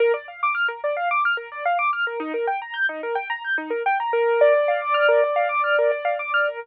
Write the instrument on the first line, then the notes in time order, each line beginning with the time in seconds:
acoustic grand piano
0.00 A#4
0.14 D5
0.28 F5
0.43 D6
0.55 F6
0.68 A#4
0.84 D5
0.97 F5
1.11 D6
1.25 F6
1.37 A#4
1.52 D5
1.65 F5
1.79 D6
1.93 F6
2.07 A#4
2.20 D#4
2.34 A#4
2.47 G5
2.62 A#5
2.74 G6
2.89 D#4
3.03 A#4
3.15 G5
3.30 A#5
3.44 G6
3.58 D#4
3.70 A#4
3.86 G5
4.00 A#5
4.13 A#4
4.41 D5
4.54 D5
4.68 F5
4.82 D6
4.94 F6
5.08 A#4
5.24 D5
5.36 F5
5.49 D6
5.64 F6
5.79 A#4
5.92 D5
6.05 F5
6.19 D6
6.34 F6
6.47 A#4